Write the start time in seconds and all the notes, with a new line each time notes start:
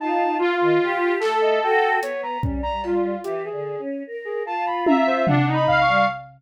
0.00 D#4 F4 A5
0.39 F4
0.61 D#3
0.82 G4
1.20 A3 A4, clap
1.42 D#5
1.63 F#4 G5
2.01 B3 C#5, closed hi-hat
2.23 A#5
2.43 G3 C#4, kick
2.63 A#5
2.83 F4, cowbell
3.24 E3 G4, closed hi-hat
3.44 G#4
3.52 D3
3.79 C#4
4.07 A#4
4.25 G#4
4.45 F4 A5
4.66 B5
4.86 E5 A#5, high tom
5.07 C5
5.27 D4 F#5, floor tom
5.47 D#4
5.54 B5
5.67 F5, kick
5.81 C#6
5.87 G3